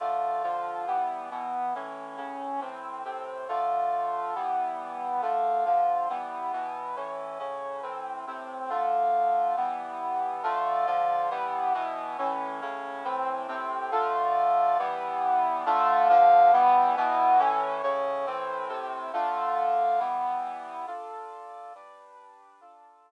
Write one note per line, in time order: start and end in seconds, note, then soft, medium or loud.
0.00 0.43 D3 medium
0.00 0.43 A3 medium
0.00 0.43 F4 medium
0.43 0.86 D3 medium
0.43 0.86 F3 medium
0.43 0.86 F4 medium
0.87 1.30 E3 medium
0.87 1.30 G3 medium
0.87 1.30 B3 medium
1.31 1.74 B2 medium
1.31 1.74 E3 medium
1.31 1.74 B3 medium
1.75 2.16 A2 medium
1.75 2.18 E3 medium
1.75 2.16 C#4 medium
2.17 2.60 A2 medium
2.17 2.60 C#3 medium
2.17 2.60 C#4 medium
2.61 3.04 A2 medium
2.61 3.04 E3 medium
2.61 3.04 C4 medium
3.04 3.47 A2 medium
3.04 3.47 C3 medium
3.04 3.47 C4 medium
3.48 4.35 D3 medium
3.48 4.35 A3 medium
3.48 4.35 F4 medium
4.35 5.21 E3 medium
4.35 5.21 G3 medium
4.35 5.21 B3 medium
5.22 5.64 D3 medium
5.22 5.65 A3 medium
5.22 5.64 F4 medium
5.65 6.08 D3 medium
5.65 6.08 F3 medium
5.65 6.08 F4 medium
6.09 6.52 E3 medium
6.09 6.52 G3 medium
6.09 6.52 B3 medium
6.53 6.96 B2 medium
6.53 6.96 E3 medium
6.53 6.96 B3 medium
6.96 7.38 A2 medium
6.96 7.39 E3 medium
6.96 7.38 C#4 medium
7.39 7.82 A2 medium
7.39 7.82 C#3 medium
7.39 7.82 C#4 medium
7.82 8.25 A2 medium
7.82 8.25 E3 medium
7.82 8.25 C4 medium
8.27 8.70 A2 medium
8.27 8.70 C3 medium
8.27 8.70 C4 medium
8.69 9.56 D3 medium
8.69 9.56 A3 medium
8.69 9.56 F4 medium
9.57 10.43 E3 medium
9.57 10.43 G3 medium
9.57 10.43 B3 medium
10.43 10.86 D3 loud
10.43 10.86 A3 loud
10.43 10.86 F4 loud
10.86 11.29 D3 loud
10.86 11.29 F3 medium
10.86 11.29 F4 loud
11.30 11.73 E3 medium
11.30 11.73 G3 medium
11.30 11.73 B3 loud
11.74 12.17 B2 loud
11.74 12.17 E3 loud
11.74 12.17 B3 loud
12.18 12.61 A2 loud
12.18 12.61 E3 loud
12.18 12.61 C#4 medium
12.61 13.04 A2 medium
12.61 13.04 C#3 loud
12.61 13.04 C#4 loud
13.04 13.47 A2 medium
13.04 13.47 E3 medium
13.04 13.47 C4 medium
13.48 13.91 A2 loud
13.48 13.91 C3 loud
13.48 13.91 C4 medium
13.91 14.78 D3 loud
13.91 14.78 A3 loud
13.91 14.78 F4 loud
14.79 15.65 E3 loud
14.79 15.65 G3 medium
14.79 15.65 B3 loud
15.66 16.08 D3 loud
15.66 16.09 A3 loud
15.66 16.08 F4 loud
16.09 16.52 D3 loud
16.09 16.52 F3 loud
16.09 16.52 F4 loud
16.53 16.96 E3 loud
16.53 16.96 G3 loud
16.53 16.96 B3 loud
16.96 17.39 B2 loud
16.96 17.38 E3 loud
16.96 17.39 B3 loud
17.39 17.82 A2 loud
17.39 17.82 E3 loud
17.39 17.82 C#4 loud
17.83 18.26 A2 loud
17.83 18.26 C#3 loud
17.83 18.26 C#4 loud
18.26 18.68 A2 loud
18.26 18.69 E3 loud
18.26 18.68 C4 loud
18.69 19.12 A2 loud
18.69 19.12 C3 loud
18.69 19.12 C4 loud
19.13 19.99 D3 loud
19.13 19.99 A3 loud
19.13 19.99 F4 loud
19.99 20.85 E3 loud
19.99 20.85 G3 loud
19.99 20.85 B3 loud
20.87 21.73 D4 medium
20.87 21.73 F4 medium
20.87 21.73 A4 medium
21.75 22.61 G3 medium
21.75 22.60 D4 medium
21.75 22.61 B4 medium
22.61 23.11 D4 medium
22.61 23.11 F4 medium
22.61 23.11 A4 medium